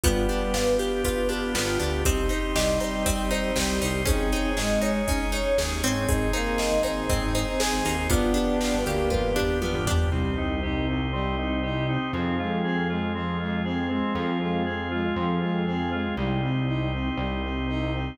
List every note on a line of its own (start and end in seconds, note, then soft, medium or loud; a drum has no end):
0.03 0.26 G1 medium
0.03 0.53 G3 medium
0.03 2.01 B3 medium
0.03 0.53 B3 loud
0.03 1.55 B3 medium
0.03 2.04 B3 medium
0.03 2.01 D4 medium
0.03 2.04 D4 medium
0.03 0.27 F4 medium
0.03 2.01 F4 medium
0.03 2.04 F4 medium
0.03 2.01 G4 medium
0.03 2.04 G4 medium
0.03 kick loud
0.03 closed hi-hat loud
0.29 1.28 D4 medium
0.29 0.52 G4 medium
0.29 closed hi-hat medium
0.54 0.77 G1 medium
0.54 1.04 F4 medium
0.54 0.77 B4 medium
0.54 snare loud
0.79 1.02 G4 medium
0.79 1.99 G4 medium
0.79 closed hi-hat medium
1.04 2.01 F4 medium
1.04 1.28 B4 medium
1.04 kick medium
1.04 closed hi-hat loud
1.29 1.79 D4 medium
1.29 1.53 G4 medium
1.29 closed hi-hat medium
1.55 1.77 G1 medium
1.55 2.03 B3 medium
1.55 1.78 F4 medium
1.55 snare loud
1.80 2.03 D2 medium
1.80 2.04 D4 medium
1.80 2.03 G4 medium
1.80 closed hi-hat medium
2.05 2.28 C2 medium
2.05 4.05 C4 medium
2.05 4.03 C4 medium
2.05 2.29 C4 loud
2.05 4.05 D#4 medium
2.05 4.03 D#4 medium
2.05 4.05 G4 medium
2.05 2.28 G4 medium
2.05 4.03 G4 loud
2.05 kick loud
2.05 closed hi-hat loud
2.29 2.52 D#4 medium
2.29 2.54 C5 medium
2.29 closed hi-hat medium
2.56 2.78 C2 medium
2.56 3.50 G3 loud
2.56 2.78 G4 medium
2.56 2.79 D#5 medium
2.56 snare loud
2.80 3.03 D#4 medium
2.80 3.04 C5 medium
2.80 closed hi-hat medium
3.06 3.29 C4 medium
3.06 3.29 D#5 medium
3.06 kick loud
3.06 closed hi-hat loud
3.31 3.53 D#4 medium
3.31 3.54 C5 medium
3.31 closed hi-hat medium
3.56 3.79 C2 medium
3.56 4.01 G3 loud
3.56 3.78 G4 medium
3.56 3.80 G4 medium
3.56 snare loud
3.82 4.05 C2 medium
3.82 4.04 D#4 medium
3.82 4.05 C5 medium
3.82 open hi-hat medium
4.05 4.30 G#1 medium
4.05 4.50 C4 loud
4.05 4.28 C#4 medium
4.05 6.06 C#4 medium
4.05 6.05 C#4 medium
4.05 6.06 D#4 medium
4.05 4.50 D#4 loud
4.05 6.05 D#4 medium
4.05 6.06 G#4 medium
4.05 4.30 G#4 medium
4.05 6.05 G#4 medium
4.05 kick loud
4.05 closed hi-hat loud
4.32 4.55 D#4 medium
4.32 4.55 C#5 medium
4.32 closed hi-hat medium
4.57 4.80 G#1 medium
4.57 5.01 G#3 loud
4.57 4.79 G#4 medium
4.57 4.80 D#5 medium
4.57 snare loud
4.82 5.04 D#4 medium
4.82 5.06 C#5 medium
4.82 closed hi-hat medium
5.07 5.31 C#4 medium
5.07 5.30 D#4 loud
5.07 5.31 D#5 loud
5.07 kick loud
5.07 closed hi-hat loud
5.32 5.55 D#4 medium
5.32 5.56 C#5 medium
5.32 closed hi-hat medium
5.58 5.81 D#2 medium
5.58 5.81 G#4 medium
5.58 snare loud
5.83 6.06 G#1 medium
5.83 6.32 C4 loud
5.83 6.07 C#5 medium
5.83 closed hi-hat medium
6.08 6.31 G#1 medium
6.08 8.08 C4 medium
6.08 8.06 C4 medium
6.08 8.08 D#4 medium
6.08 8.06 D#4 medium
6.08 6.30 D#4 loud
6.08 8.08 G#4 medium
6.08 8.06 G#4 medium
6.08 6.32 G#4 medium
6.08 kick loud
6.08 closed hi-hat loud
6.33 6.78 A#3 loud
6.33 6.56 D#4 medium
6.33 6.57 C5 medium
6.33 closed hi-hat medium
6.58 6.81 G#4 medium
6.58 6.82 D#5 medium
6.58 snare loud
6.72 6.83 G#1 medium
6.83 7.06 G#1 medium
6.83 7.06 D#4 medium
6.83 7.07 C5 medium
6.83 closed hi-hat medium
7.09 7.21 G#1 medium
7.09 7.32 C4 medium
7.09 7.33 D#5 medium
7.09 kick loud
7.09 closed hi-hat loud
7.22 7.45 G#1 medium
7.22 7.34 D#4 loud
7.34 7.46 C4 medium
7.34 7.58 D#4 medium
7.34 7.58 C5 medium
7.34 closed hi-hat medium
7.47 7.59 D#4 loud
7.60 7.96 G#4 loud
7.60 7.83 G#4 medium
7.60 7.84 G#4 medium
7.60 snare loud
7.73 7.84 G#1 medium
7.85 8.08 D#2 medium
7.85 8.08 D#4 medium
7.85 8.08 C5 medium
7.85 open hi-hat medium
8.10 8.33 G1 medium
8.10 8.32 B3 loud
8.10 10.08 B3 medium
8.10 8.76 B3 loud
8.10 10.10 B3 medium
8.10 10.08 D4 medium
8.10 8.76 D4 loud
8.10 10.10 D4 medium
8.10 10.08 F4 medium
8.10 8.34 F4 medium
8.10 10.10 F4 medium
8.10 10.08 G4 medium
8.10 10.10 G4 medium
8.10 kick loud
8.10 closed hi-hat loud
8.34 8.57 D4 medium
8.34 8.59 G4 medium
8.34 closed hi-hat medium
8.61 8.84 F4 medium
8.61 8.84 B4 medium
8.61 snare loud
8.74 8.85 G1 medium
8.86 9.09 D2 medium
8.86 9.29 A#3 loud
8.86 9.09 G4 medium
8.86 9.10 G4 medium
8.86 closed hi-hat medium
9.10 9.22 G1 medium
9.10 9.33 F4 medium
9.10 9.34 B4 loud
9.10 kick medium
9.10 high tom medium
9.24 9.47 G1 medium
9.36 9.59 D4 medium
9.36 9.59 G4 medium
9.36 floor tom loud
9.62 9.84 B3 medium
9.62 9.85 F4 medium
9.62 high tom loud
9.74 9.86 G1 medium
9.87 10.09 G1 medium
9.87 10.10 D4 medium
9.87 10.10 G4 medium
9.87 floor tom loud
10.12 11.97 C2 loud
10.12 10.35 G3 medium
10.12 12.11 C4 medium
10.12 10.35 C4 loud
10.12 12.11 D#4 medium
10.12 12.11 G4 medium
10.37 10.61 C4 medium
10.37 10.60 D#4 medium
10.63 10.86 D#4 medium
10.63 10.85 G4 medium
10.88 11.11 C4 medium
10.88 11.10 D#4 medium
11.13 11.36 G3 medium
11.13 11.35 C4 medium
11.38 11.61 C4 medium
11.38 11.61 D#4 medium
11.63 11.87 D#4 medium
11.63 11.86 G4 medium
11.88 12.12 C4 medium
11.88 12.11 D#4 medium
12.13 13.99 F2 loud
12.13 12.37 F3 medium
12.13 12.36 C4 loud
12.13 14.14 C4 medium
12.13 14.14 F4 medium
12.13 14.14 G#4 medium
12.39 12.62 G#3 medium
12.39 12.62 F4 medium
12.64 12.87 C4 medium
12.64 12.87 G#4 medium
12.89 13.12 G#3 medium
12.89 13.12 F4 medium
13.14 13.38 F3 medium
13.14 13.37 C4 loud
13.40 13.63 G#3 medium
13.40 13.62 F4 medium
13.65 13.88 C4 medium
13.65 13.88 G#4 medium
13.90 14.13 G#3 medium
13.90 14.38 C4 loud
14.15 15.08 F2 medium
14.15 14.39 F3 medium
14.15 16.15 C4 medium
14.15 16.15 F4 medium
14.15 16.15 G#4 medium
14.40 14.64 G#3 medium
14.40 14.63 F4 medium
14.65 14.89 C4 medium
14.65 14.89 G#4 medium
14.91 15.14 G#3 medium
14.91 15.14 F4 medium
15.16 16.09 F2 medium
15.16 15.39 F3 medium
15.16 15.39 C4 medium
15.41 15.65 G#3 medium
15.41 15.64 F4 medium
15.66 15.90 C4 medium
15.66 15.89 G#4 medium
15.92 16.16 G#3 medium
15.92 16.14 F4 medium
16.17 17.10 C2 loud
16.17 16.41 G3 medium
16.17 18.17 C4 medium
16.17 18.17 D#4 medium
16.17 18.17 G4 medium
16.42 16.65 C4 medium
16.67 16.90 D#4 medium
16.93 17.16 C4 medium
17.17 18.10 C2 medium
17.17 17.41 G3 medium
17.43 17.66 C4 medium
17.68 17.91 D#4 medium
17.93 18.17 C4 medium